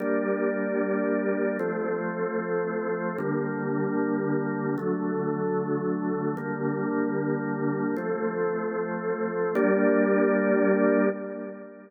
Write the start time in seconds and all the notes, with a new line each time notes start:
0.00 G3 A#3 D4
1.59 F3 A3 C4
3.18 D3 G3 A#3
4.78 D3 F#3 A3
6.37 D3 G3 A#3
7.96 F3 A3 C4
9.55 G3 A#3 D4